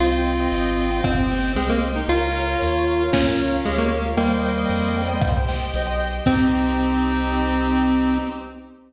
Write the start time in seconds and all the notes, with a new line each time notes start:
0.00 C2 C4 F4 C5 D#5 G5, closed hi-hat
0.26 G5, snare, closed hi-hat
0.40 C5 D#5 G5
0.52 G#1 D#5, closed hi-hat
0.78 C5 D#5 G5, closed hi-hat
0.91 C5 D#5 G5
1.04 G1 C4 G4 C5 G5, kick, cross-stick
1.18 C5 D#5 G5
1.30 C5 D#5 G5, snare, closed hi-hat
1.55 C2 G#3 C4 C5 D#5 G5, closed hi-hat
1.69 A#3 C5 D#5 G5
1.82 G5, closed hi-hat
1.96 D#4
2.08 C#2 F4 A#4 C#5 F5, closed hi-hat
2.34 F5, closed hi-hat
2.47 A#4 C#5 F5
2.61 D#2 C#5, closed hi-hat
2.87 A#4 C#5 F5, closed hi-hat
2.99 A#4 C#5 F5
3.12 C#2 C#4 F4 A#4 F5, kick, snare
3.27 A#4 C#5 F5
3.38 A#4 C#5 F5, snare, closed hi-hat
3.65 D2 G#3 G4 A#4 C#5 F5, closed hi-hat
3.78 A#3 A#4 C#5 F5
3.90 F5, closed hi-hat
4.17 D#2 G3 A#3 C5 D#5 G5, closed hi-hat
4.43 G5, closed hi-hat
4.57 C5 D#5 G5
4.69 F2 D#5, closed hi-hat
4.95 G3 C5 D#5 G5, closed hi-hat
5.08 C5 D#5 G5
5.20 C2 G4 C5 G5, kick, cross-stick
5.36 C5 D#5 G5
5.48 C5 D#5 G5, snare, closed hi-hat
5.73 B1 C5 D#5 G5, closed hi-hat
5.87 C5 D#5 G5
6.00 G5, closed hi-hat
6.26 C2 C4 D#4 G4 C5 D#5 G5, kick, crash